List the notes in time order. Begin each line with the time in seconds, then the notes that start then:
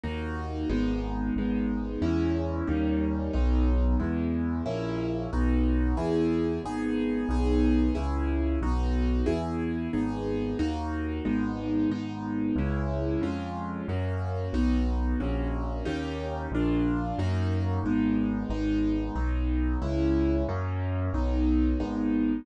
0.03 D#2 A#3 D#4 F#4
0.69 G#1 G#3 B3 D#4
1.36 G#1 G#3 B3 D#4
2.02 E2 G#3 C#4 E4
2.67 D#2 G3 A#3 C#4 D#4
3.33 B1 F#3 B3 D#4
3.99 E2 G#3 B3 E4
4.66 A#1 A#3 C#4 E4
5.33 B1 B3 D#4 F#4
5.97 E2 B3 E4 G#4
6.63 G#1 B3 D#4 G#4
7.29 B1 B3 D#4 G#4
7.95 C#2 C#4 E4 G#4
8.61 B1 B3 D#4 F#4
9.26 E2 B3 E4 G#4
9.93 G#1 B3 D#4 G#4
10.59 D#2 A#3 D#4 F#4
11.25 G#1 G#3 B3 D#4
11.90 G#1 G#3 B3 D#4
12.56 C#2 G#3 C#4 E4
13.21 F2 G#3 C#4 F4
13.88 F#2 A#3 C#4 F#4
14.53 B1 B3 D#4 F#4
15.20 A#1 A#3 C#4 F#4
15.85 D#2 A#3 C#4 D#4 G4
16.51 A#1 A#3 D4 F4
17.18 F#2 A#3 D#4 F#4
17.83 G#1 G#3 B3 D#4
18.49 G#1 G#3 B3 D#4
19.15 B1 F#3 B3 D#4
19.82 C#2 G#3 C#4 E4
20.48 F#2 F#3 A#3 C#4
21.13 B1 F#3 B3 D#4
21.80 G#1 G#3 B3 D#4